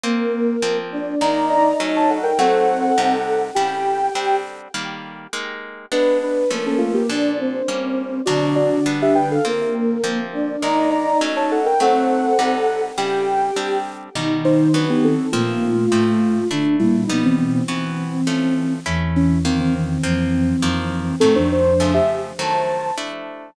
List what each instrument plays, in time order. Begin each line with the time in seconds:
0.04 acoustic guitar (steel) A#3 C4 F4, flute A#3 A#4
0.62 acoustic guitar (steel) F3 A#3 C4
0.92 flute D4 D5
1.21 acoustic guitar (steel) D#3 G#3 A#3, flute D#4 D#5, ocarina D5 A#5
1.49 ocarina D5 A#5
1.80 acoustic guitar (steel) F#3 A3 C#4
1.96 ocarina C#5 A5
2.10 ocarina A4 F#5
2.23 ocarina A#4 G5
2.39 acoustic guitar (steel) F#3 A3 C4, flute C4 C5, ocarina A4 F#5
2.98 acoustic guitar (steel) C3 G3 D#4
3.55 acoustic guitar (steel) C#3 G3 E4, ocarina G4 G5
4.15 acoustic guitar (steel) G3 C4 D4
4.74 acoustic guitar (steel) D#3 G3 A#3
5.33 acoustic guitar (steel) G#3 A#3 D#4
5.92 acoustic guitar (steel) G#3 B3 D4, ocarina D4 B4
6.23 ocarina D4 B4
6.50 acoustic guitar (steel) F3 A3 C#4, flute A#3 A#4
6.67 ocarina C#4 A4
6.78 ocarina A3 F4
6.94 ocarina A#3 G4
7.09 acoustic guitar (steel) A#2 F3 D4, flute D4 D5
7.39 flute C4 C5
7.68 acoustic guitar (steel) G3 A#3 C#4
8.26 acoustic guitar (steel) B2 F#3 D4, flute D3 D4, ocarina F#4 D5
8.56 ocarina F#4 D5
8.86 acoustic guitar (steel) G3 B3 D4
9.02 ocarina G4 E5
9.15 ocarina B4 G5
9.31 ocarina A4 F5
9.45 acoustic guitar (steel) A#3 C4 F4, flute A#3 A#4
10.04 acoustic guitar (steel) F3 A#3 C4
10.33 flute D4 D5
10.62 acoustic guitar (steel) D#3 G#3 A#3, flute D#4 D#5, ocarina D5 A#5
10.91 ocarina D5 A#5
11.21 acoustic guitar (steel) F#3 A3 C#4
11.36 ocarina C#5 A5
11.51 ocarina A4 F#5
11.66 ocarina A#4 G5
11.80 acoustic guitar (steel) F#3 A3 C4, flute C4 C5, ocarina A4 F#5
12.39 acoustic guitar (steel) C3 G3 D#4
12.98 acoustic guitar (steel) C#3 G3 E4, ocarina G4 G5
13.56 acoustic guitar (steel) G3 C4 D4
14.15 acoustic guitar (steel) B2 G3 D#4, flute D#3 D#4
14.45 ocarina D#4 C5
14.74 acoustic guitar (steel) E3 F#3 B3, ocarina D4 B4
14.90 ocarina B3 G4
15.04 ocarina C4 A4
15.32 flute A#2 A#3, acoustic guitar (steel) F3 A#3 C4, ocarina A3 F4
15.92 flute A2 A3, acoustic guitar (steel) F3 A3 C4
16.51 flute D3 D4, acoustic guitar (steel) A3 D4 E4
16.80 flute A#2 A#3, ocarina G3 E4
17.07 flute B2 B3, ocarina F3 D#4, acoustic guitar (steel) G3 B3 D#4
17.25 ocarina E3 C4
17.38 ocarina E3 C4
17.68 acoustic guitar (steel) E3 B3 F#4, ocarina E3 C4
18.27 acoustic guitar (steel) F3 A3 C#4
18.86 flute E2 E3, acoustic guitar (steel) A3 C#4 E4
19.16 ocarina E3 C#4
19.45 acoustic guitar (steel) D#3 A#3 F4, ocarina D#3 C4
19.60 ocarina D#3 C4
19.75 ocarina D#3 C4
20.03 flute F2 F3, ocarina E3 C4, acoustic guitar (steel) F3 A#3 C4
20.62 flute F2 F3, acoustic guitar (steel) D#3 F3 A#3
21.20 flute A2 A3, acoustic guitar (steel) D#3 F#3 A3, ocarina C4 A4
21.35 flute F2 F3, ocarina D4 C5
21.52 ocarina D4 C5
21.80 acoustic guitar (steel) C#3 F3 A3
21.94 ocarina G4 E5
22.39 acoustic guitar (steel) D#3 F#3 A3, ocarina C5 A5
22.98 acoustic guitar (steel) A3 D4 E4